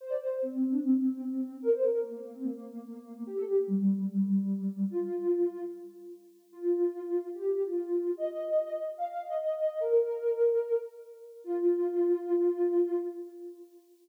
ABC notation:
X:1
M:4/4
L:1/16
Q:1/4=147
K:Fmix
V:1 name="Ocarina"
c d c2 C3 D C8 | B c B2 B,3 C B,8 | G A G2 G,3 G, G,8 | F8 z8 |
F8 G G2 F F4 | e8 f f2 e e4 | B10 z6 | F16 |]